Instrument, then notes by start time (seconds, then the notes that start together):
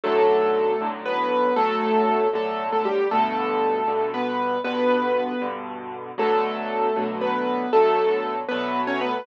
acoustic grand piano
0.04 B1 A2 D3 F#3 A3 A4
0.81 B1 A2 D3 F#3
1.06 B3 B4
1.56 B1 A2 D3 F#3 A3 A4
2.33 B1 A2 D3 F#3 A3 A4
2.72 A3 A4
2.85 G3 G4
3.11 G2 B2 D3 A3 A4
3.87 G2 B2 D3
4.14 B3 B4
4.64 G2 B2 D3 B3 B4
5.42 G2 B2 D3
6.18 B2 D3 F#3 A3 A4
6.96 B2 D3 F#3 A3
7.21 B3 B4
7.73 B2 D3 F#3 A3 A4
8.49 B2 D3 F#3 A3 B3 B4
8.87 C#4 C#5
9.01 B3 B4